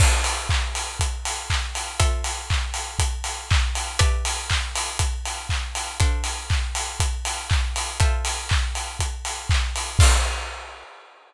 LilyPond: <<
  \new Staff \with { instrumentName = "Pizzicato Strings" } { \time 4/4 \key d \dorian \tempo 4 = 120 <d' a' c'' f''>1 | <f' a' c'' e''>1 | <g' b' d'' e''>1 | <d' a' c'' f''>1 |
<f' a' c'' e''>1 | <d' a' c'' f''>4 r2. | }
  \new DrumStaff \with { instrumentName = "Drums" } \drummode { \time 4/4 <cymc bd>8 hho8 <hc bd>8 hho8 <hh bd>8 hho8 <hc bd>8 hho8 | <hh bd>8 hho8 <hc bd>8 hho8 <hh bd>8 hho8 <hc bd>8 hho8 | <hh bd>8 hho8 <hc bd>8 hho8 <hh bd>8 hho8 <hc bd>8 hho8 | <hh bd>8 hho8 <hc bd>8 hho8 <hh bd>8 hho8 <hc bd>8 hho8 |
<hh bd>8 hho8 <hc bd>8 hho8 <hh bd>8 hho8 <hc bd>8 hho8 | <cymc bd>4 r4 r4 r4 | }
>>